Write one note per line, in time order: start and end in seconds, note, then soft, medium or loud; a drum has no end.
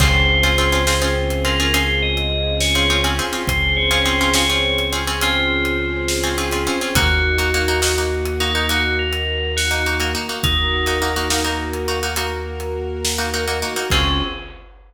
0.00 3.20 C#2 loud
0.00 0.35 C4 loud
0.00 3.45 C4 medium
0.00 0.35 C#4 loud
0.00 3.45 C#4 medium
0.00 0.35 F4 loud
0.00 3.45 F4 medium
0.00 0.35 G#4 loud
0.00 3.45 G#4 medium
0.00 1.42 C5 loud
0.00 kick loud
0.00 crash loud
0.43 0.55 C4 medium
0.43 0.55 C#4 loud
0.43 0.55 F4 loud
0.43 0.55 G#4 loud
0.43 closed hi-hat medium
0.58 0.70 C4 loud
0.58 0.70 C#4 loud
0.58 0.70 F4 loud
0.58 0.70 G#4 loud
0.72 0.84 C4 medium
0.72 0.84 C#4 medium
0.72 0.84 F4 loud
0.72 0.84 G#4 loud
0.87 0.99 C4 loud
0.87 0.99 C#4 medium
0.87 0.99 F4 medium
0.87 0.99 G#4 medium
0.87 snare loud
1.02 1.36 C4 loud
1.02 1.36 C#4 loud
1.02 1.36 F4 loud
1.02 1.36 G#4 loud
1.30 closed hi-hat medium
1.45 1.56 C4 medium
1.45 1.56 C#4 medium
1.45 1.56 F4 loud
1.45 1.56 G#4 loud
1.45 1.72 A#4 loud
1.60 1.71 C4 medium
1.60 1.71 C#4 medium
1.60 1.71 F4 loud
1.60 1.71 G#4 medium
1.74 2.20 C4 medium
1.74 2.20 C#4 loud
1.74 2.20 F4 loud
1.74 2.20 G#4 loud
1.74 2.01 C5 loud
1.74 closed hi-hat loud
2.02 2.55 D#5 loud
2.17 closed hi-hat medium
2.61 2.98 C#5 loud
2.61 snare loud
2.75 2.87 C4 loud
2.75 2.87 C#4 loud
2.75 2.87 F4 loud
2.75 2.87 G#4 medium
2.90 3.02 C4 medium
2.90 3.02 C#4 loud
2.90 3.02 F4 loud
2.90 3.02 G#4 loud
3.04 3.16 C4 loud
3.04 3.16 C#4 loud
3.04 3.16 F4 medium
3.04 3.16 G#4 medium
3.04 closed hi-hat medium
3.19 3.30 C4 loud
3.19 3.30 C#4 medium
3.19 3.30 F4 loud
3.19 3.30 G#4 loud
3.33 3.79 C4 medium
3.33 3.79 C#4 medium
3.33 3.79 F4 medium
3.33 3.79 G#4 medium
3.47 6.68 C#2 loud
3.47 6.93 C4 medium
3.47 6.93 C#4 medium
3.47 6.93 G#4 medium
3.47 3.72 C5 loud
3.47 6.93 C5 medium
3.47 kick loud
3.47 closed hi-hat loud
3.77 4.01 C#5 loud
3.91 4.02 C4 loud
3.91 4.02 C#4 medium
3.91 4.02 F4 loud
3.91 4.02 G#4 loud
3.91 closed hi-hat medium
4.05 4.17 C4 loud
4.05 4.17 C#4 loud
4.05 4.17 F4 medium
4.05 4.17 G#4 loud
4.05 4.29 C5 loud
4.21 4.32 C4 medium
4.21 4.32 C#4 loud
4.21 4.32 F4 loud
4.21 4.32 G#4 medium
4.34 4.46 C4 medium
4.34 4.46 C#4 loud
4.34 4.46 F4 medium
4.34 4.46 G#4 loud
4.34 4.85 C#5 loud
4.34 snare loud
4.50 4.84 C4 loud
4.50 4.84 C#4 medium
4.50 4.84 F4 medium
4.50 4.84 G#4 medium
4.78 closed hi-hat medium
4.93 5.04 C4 loud
4.93 5.04 C#4 loud
4.93 5.04 F4 loud
4.93 5.04 G#4 medium
5.07 5.19 C4 loud
5.07 5.19 C#4 loud
5.07 5.19 F4 medium
5.07 5.19 G#4 loud
5.21 5.69 C4 loud
5.21 5.69 C#4 medium
5.21 6.77 F4 loud
5.21 5.69 F4 medium
5.21 5.69 G#4 medium
5.21 closed hi-hat loud
5.65 closed hi-hat medium
6.08 snare loud
6.23 6.35 C4 loud
6.23 6.35 C#4 loud
6.23 6.35 F4 medium
6.23 6.35 G#4 loud
6.38 6.49 C4 medium
6.38 6.49 C#4 loud
6.38 6.49 F4 loud
6.38 6.49 G#4 loud
6.51 6.64 C4 medium
6.51 6.64 C#4 loud
6.51 6.64 F4 loud
6.51 6.64 G#4 loud
6.51 closed hi-hat medium
6.67 6.78 C4 loud
6.67 6.78 C#4 loud
6.67 6.78 F4 loud
6.67 6.78 G#4 loud
6.81 6.93 C4 medium
6.81 6.93 C#4 loud
6.81 6.93 F4 loud
6.81 6.93 G#4 medium
6.95 10.15 D#2 loud
6.95 7.31 A#3 loud
6.95 10.41 A#3 medium
6.95 7.31 D#4 loud
6.95 10.41 D#4 medium
6.95 8.37 F#4 loud
6.95 7.31 F#4 loud
6.95 10.41 F#4 medium
6.95 kick loud
6.95 closed hi-hat loud
7.38 7.50 A#3 medium
7.38 7.50 D#4 medium
7.38 7.50 F#4 loud
7.38 closed hi-hat medium
7.54 7.66 A#3 loud
7.54 7.66 D#4 loud
7.54 7.66 F#4 medium
7.68 7.80 A#3 medium
7.68 7.80 D#4 loud
7.68 7.80 F#4 loud
7.82 7.94 A#3 loud
7.82 7.94 D#4 medium
7.82 7.94 F#4 medium
7.82 snare loud
7.98 8.33 A#3 medium
7.98 8.33 D#4 loud
7.98 8.33 F#4 medium
8.25 closed hi-hat medium
8.40 8.52 A#3 medium
8.40 8.52 D#4 medium
8.40 8.68 D#4 loud
8.40 8.52 F#4 loud
8.55 8.67 A#3 medium
8.55 8.67 D#4 medium
8.55 8.67 F#4 medium
8.69 9.17 A#3 medium
8.69 9.17 D#4 medium
8.69 8.95 F#4 loud
8.69 9.17 F#4 medium
8.69 closed hi-hat loud
8.99 9.51 A#4 medium
9.13 closed hi-hat medium
9.57 9.96 F#4 loud
9.57 snare loud
9.71 9.82 A#3 loud
9.71 9.82 D#4 loud
9.71 9.82 F#4 medium
9.86 9.98 A#3 medium
9.86 9.98 D#4 loud
9.86 9.98 F#4 loud
10.00 10.12 A#3 loud
10.00 10.12 D#4 loud
10.00 10.12 F#4 medium
10.00 closed hi-hat medium
10.15 10.26 A#3 loud
10.15 10.26 D#4 medium
10.15 10.26 F#4 medium
10.29 10.75 A#3 medium
10.29 10.75 D#4 medium
10.29 10.75 F#4 medium
10.43 13.64 D#2 medium
10.43 13.88 A#3 medium
10.43 11.69 D#4 loud
10.43 13.88 F#4 medium
10.43 13.88 A#4 medium
10.43 kick loud
10.43 closed hi-hat loud
10.86 10.99 A#3 medium
10.86 10.99 D#4 loud
10.86 10.99 F#4 medium
10.86 closed hi-hat medium
11.02 11.13 A#3 loud
11.02 11.13 D#4 loud
11.02 11.13 F#4 medium
11.16 11.28 A#3 loud
11.16 11.28 D#4 medium
11.16 11.28 F#4 loud
11.30 11.42 A#3 loud
11.30 11.42 D#4 loud
11.30 11.42 F#4 loud
11.30 snare loud
11.44 11.79 A#3 medium
11.44 11.79 D#4 loud
11.44 11.79 F#4 medium
11.73 closed hi-hat medium
11.88 12.00 A#3 medium
11.88 12.00 D#4 medium
11.88 12.00 F#4 medium
12.03 12.14 A#3 loud
12.03 12.14 D#4 loud
12.03 12.14 F#4 loud
12.16 12.64 A#3 loud
12.16 12.64 D#4 loud
12.16 12.64 F#4 medium
12.16 closed hi-hat loud
12.60 closed hi-hat medium
13.05 snare loud
13.18 13.30 A#3 medium
13.18 13.30 D#4 loud
13.18 13.30 F#4 loud
13.34 13.45 A#3 medium
13.34 13.45 D#4 loud
13.34 13.45 F#4 loud
13.48 13.59 A#3 loud
13.48 13.59 D#4 medium
13.48 13.59 F#4 loud
13.48 closed hi-hat medium
13.62 13.74 A#3 medium
13.62 13.74 D#4 loud
13.62 13.74 F#4 loud
13.76 13.88 A#3 loud
13.76 13.88 D#4 medium
13.76 13.88 F#4 medium
13.90 14.22 C#2 loud
13.90 14.21 C4 loud
13.90 14.22 C4 loud
13.90 14.21 C#4 loud
13.90 14.22 C#4 loud
13.90 14.21 F4 loud
13.90 14.22 F4 loud
13.90 14.21 G#4 medium
13.90 14.22 G#4 medium
13.90 kick loud
13.90 crash loud